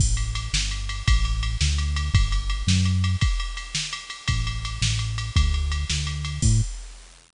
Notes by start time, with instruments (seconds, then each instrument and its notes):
0.00 synth bass 1 A1, kick, crash
0.17 ride
0.35 ride
0.53 synth bass 1 G1, snare
0.71 ride
0.89 ride
1.07 synth bass 1 A1, kick, ride
1.25 ride
1.43 ride
1.61 synth bass 1 D2, snare
1.78 ride
1.96 ride
2.14 synth bass 1 G1, kick, ride
2.32 ride
2.50 ride
2.67 synth bass 1 F#2, snare
2.85 ride
3.04 ride
3.21 kick, ride
3.40 ride
3.57 ride
3.75 snare
3.93 ride
4.10 ride
4.28 synth bass 1 A1, kick, ride
4.47 ride
4.65 ride
4.82 synth bass 1 A1, snare
4.99 ride
5.18 ride
5.36 synth bass 1 D2, kick, ride
5.54 ride
5.72 ride
5.90 synth bass 1 D2, snare
6.07 ride
6.25 ride
6.42 synth bass 1 A2, kick, crash